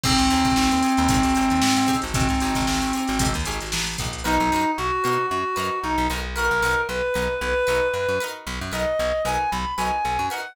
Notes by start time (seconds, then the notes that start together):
0.04 G#1 C4 D#4 G4 G#4 C5, kick, crash
0.18 G#1, snare, closed hi-hat
0.30 D#2 D#4 G4 G#4 C5, closed hi-hat
0.44 G#1, kick, snare, closed hi-hat
0.56 G#1, snare
0.71 D#2, closed hi-hat
0.83 D#4 G4 G#4 C5, closed hi-hat
0.97 D#2, closed hi-hat
1.08 G#1 D#4 G4 G#4 C5, kick, closed hi-hat
1.23 G#1, closed hi-hat
1.35 G#1 D#4 G4 G#4 C5, closed hi-hat
1.50 D#2, closed hi-hat
1.62 G#2, snare
1.77 G#2, closed hi-hat
1.87 D#4 G4 G#4 C5, kick, snare, closed hi-hat
2.02 G#1, closed hi-hat
2.14 G#1 C4, kick, closed hi-hat
2.29 G#2, snare, closed hi-hat
2.40 G#1 G4 G#4 C5, closed hi-hat
2.45 D#4
2.55 G#1, kick, snare, closed hi-hat
2.67 G#1, snare
2.82 G#1, closed hi-hat
2.93 G4 G#4 C5, closed hi-hat
2.97 D#4
3.07 G#1, snare, closed hi-hat
3.19 G#1 D#4 G4 G#4 C5, kick, closed hi-hat
3.34 D#2, closed hi-hat
3.45 G#1 D#4 G4 G#4 C5, closed hi-hat
3.61 G#1, closed hi-hat
3.72 A1, snare
3.87 snare, closed hi-hat
3.98 A#1 D#4 G4 G#4 C5, kick, closed hi-hat
4.13 closed hi-hat
4.24 B1 D#4 F#4 A#4 B4
4.40 B1
4.52 F#2 D#4 F#4 A#4 B4
4.77 B1 F#4
5.04 B2 D#4 F#4 A#4 B4
5.30 F#2 F#4
5.56 F#2 D#4 F#4 A#4 B4
5.82 B1 D#4
5.98 B1
6.10 B1 D#4 F#4 A#4 B4
6.35 D#4 F#4 A#4 B4
6.51 B1
6.62 B1 D#4 F#4 A#4 B4
6.88 B1 B4
7.14 B1 D#4 F#4 A#4 B4
7.40 B1 B4
7.67 B1 D#4 F#4 A#4 B4
7.93 F#2 B4
8.09 F#2
8.20 D#4 F#4 A#4 B4
8.47 B1
8.61 F#2
8.72 B1 D#4 F#4 A#4 B4 D#5
8.99 B1
9.25 B1 D#4 F#4 A#4 B4 G#5
9.51 B1 B5
9.77 B1 F#4 A#4 B4 G#5
9.81 D#4
10.05 B1
10.19 F#2
10.30 D#4 F#4 A#4 B4 F#5